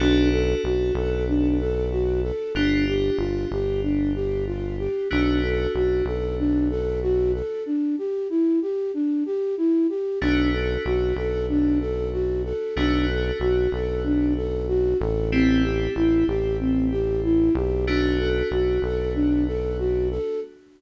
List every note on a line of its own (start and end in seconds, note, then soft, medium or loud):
0.00 0.55 B1 loud
0.00 2.50 B3 medium
0.00 0.30 D4 medium
0.00 2.50 D4 medium
0.00 2.50 F#4 medium
0.00 2.50 A4 medium
0.32 0.61 A4 medium
0.64 0.91 B1 medium
0.64 0.93 F#4 medium
0.95 2.32 B1 loud
0.95 1.26 A4 medium
1.28 1.57 D4 medium
1.59 1.89 A4 medium
1.91 2.21 F#4 medium
2.23 2.53 A4 medium
2.55 3.10 G1 medium
2.55 5.06 B3 medium
2.55 2.85 D4 medium
2.55 5.06 D4 medium
2.55 5.06 F4 medium
2.55 5.06 G4 medium
2.88 3.17 G4 medium
3.18 3.46 G1 medium
3.18 3.49 F4 medium
3.51 4.88 G1 medium
3.51 3.81 G4 medium
3.83 4.12 D4 medium
4.15 4.45 G4 medium
4.47 4.77 F4 medium
4.79 5.08 G4 medium
5.11 5.67 B1 loud
5.11 7.61 A3 medium
5.11 7.61 B3 medium
5.11 7.61 D4 medium
5.11 5.40 D4 medium
5.11 7.61 F#4 medium
5.43 5.72 A4 medium
5.74 6.02 B1 medium
5.74 6.04 F#4 medium
6.05 7.42 B1 medium
6.05 6.36 A4 medium
6.39 6.68 D4 medium
6.70 7.00 A4 medium
7.02 7.32 F#4 medium
7.34 7.64 A4 medium
7.66 7.96 D4 medium
7.98 8.28 G4 medium
8.30 8.59 E4 medium
8.62 8.92 G4 medium
8.94 9.24 D4 medium
9.26 9.55 G4 medium
9.57 9.87 E4 medium
9.89 10.19 G4 medium
10.21 10.77 B1 loud
10.21 12.72 A3 medium
10.21 12.72 B3 medium
10.21 10.51 D4 medium
10.21 12.72 D4 medium
10.21 12.72 F#4 medium
10.53 10.83 A4 medium
10.85 11.13 B1 medium
10.85 11.14 F#4 medium
11.16 12.53 B1 medium
11.16 11.46 A4 medium
11.49 11.79 D4 medium
11.81 12.10 A4 medium
12.13 12.42 F#4 medium
12.45 12.74 A4 medium
12.76 13.32 B1 loud
12.76 15.27 A3 medium
12.76 15.27 B3 medium
12.76 15.27 D4 medium
12.76 13.06 D4 medium
12.76 15.27 F#4 medium
13.08 13.38 A4 medium
13.40 13.68 B1 medium
13.40 13.70 F#4 medium
13.72 14.94 B1 medium
13.72 14.02 A4 medium
14.04 14.34 D4 medium
14.36 14.66 A4 medium
14.68 14.98 F#4 medium
15.00 15.88 A1 loud
15.00 15.29 A4 medium
15.32 17.83 A3 medium
15.32 15.62 C4 medium
15.32 17.83 C4 medium
15.32 17.83 E4 medium
15.32 17.83 G4 medium
15.64 15.93 G4 medium
15.96 16.24 A1 medium
15.96 16.25 E4 medium
16.27 17.50 A1 medium
16.27 16.57 G4 medium
16.60 16.89 C4 medium
16.91 17.21 G4 medium
17.24 17.53 E4 medium
17.55 18.42 B1 loud
17.55 17.85 G4 medium
17.87 20.38 A3 medium
17.87 20.38 B3 medium
17.87 18.17 D4 medium
17.87 20.38 D4 medium
17.87 20.38 F#4 medium
18.19 18.49 A4 medium
18.51 18.79 B1 medium
18.51 18.81 F#4 medium
18.82 20.19 B1 medium
18.82 19.13 A4 medium
19.15 19.44 D4 medium
19.47 19.77 A4 medium
19.79 20.08 F#4 medium
20.11 20.40 A4 medium